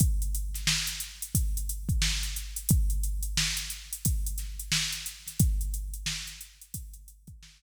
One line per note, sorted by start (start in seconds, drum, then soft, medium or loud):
0.00 kick medium
0.00 closed hi-hat medium
0.22 closed hi-hat medium
0.35 closed hi-hat medium
0.54 snare soft
0.54 closed hi-hat medium
0.67 snare loud
0.87 closed hi-hat medium
1.00 closed hi-hat medium
1.22 closed hi-hat medium
1.35 kick medium
1.35 closed hi-hat medium
1.57 closed hi-hat medium
1.69 closed hi-hat medium
1.89 kick medium
1.89 closed hi-hat soft
2.02 snare medium
2.23 closed hi-hat medium
2.36 closed hi-hat medium
2.56 closed hi-hat medium
2.69 kick medium
2.69 closed hi-hat loud
2.90 closed hi-hat medium
3.03 closed hi-hat medium
3.23 closed hi-hat medium
3.37 snare medium
3.57 closed hi-hat medium
3.70 closed hi-hat medium
3.93 closed hi-hat medium
4.05 kick medium
4.05 closed hi-hat medium
4.26 closed hi-hat medium
4.38 snare soft
4.38 closed hi-hat medium
4.59 closed hi-hat medium
4.72 snare medium
4.92 closed hi-hat medium
5.06 closed hi-hat medium
5.27 snare soft
5.27 closed hi-hat medium
5.39 kick medium
5.39 closed hi-hat medium
5.61 closed hi-hat medium
5.74 closed hi-hat medium
5.94 closed hi-hat medium
6.06 snare medium
6.27 snare soft
6.27 closed hi-hat medium
6.41 closed hi-hat medium
6.62 closed hi-hat medium
6.74 kick medium
6.74 closed hi-hat loud
6.94 closed hi-hat medium
7.08 closed hi-hat medium
7.27 kick medium
7.27 closed hi-hat medium
7.43 snare medium